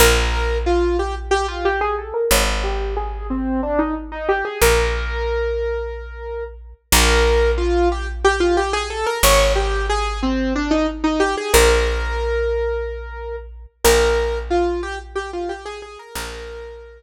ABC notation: X:1
M:7/8
L:1/16
Q:1/4=91
K:Bbmix
V:1 name="Acoustic Grand Piano"
B4 F2 G z G F G ^G =A B | _d2 G2 A2 C2 =D E z E G A | B12 z2 | B4 F2 G z G F G ^G =A B |
_d2 G2 A2 C2 =D E z E G A | B12 z2 | B4 F2 G z G F G A A B | B6 z8 |]
V:2 name="Electric Bass (finger)" clef=bass
B,,,14 | A,,,14 | B,,,14 | B,,,14 |
A,,,14 | B,,,14 | B,,,14 | B,,,14 |]